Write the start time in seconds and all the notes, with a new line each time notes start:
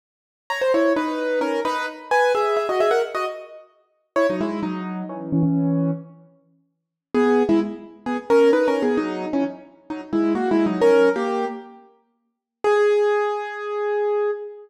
0.50 C#5 A#5
0.61 C5
0.74 E4 C#5
0.96 D#4 B4
1.41 C#4 A#4
1.65 D#4 B4
2.11 B4 G#5
2.35 G#4 E5
2.57 G#4 E5
2.69 F#4 D#5
2.80 G#4 E5
2.91 A#4 F#5
3.15 F#4 D#5
4.16 E4 C#5
4.30 F#3 D#4
4.41 G#3 E4
4.63 F#3 D#4
5.09 E3 C#4
5.32 E3 C#4
5.43 E3 C#4
7.14 B3 G#4
7.49 G#3 E4
8.06 B3 G#4
8.30 C#4 A#4
8.53 D#4 B4
8.68 C#4 A#4
8.82 B3 G#4
8.97 F#3 D#4
9.33 E3 C#4
9.90 F#3 D#4
10.13 G#3 E4
10.35 A#3 F#4
10.51 G#3 E4
10.66 F#3 D#4
10.81 C#4 A#4
11.16 A#3 G4
12.64 G#4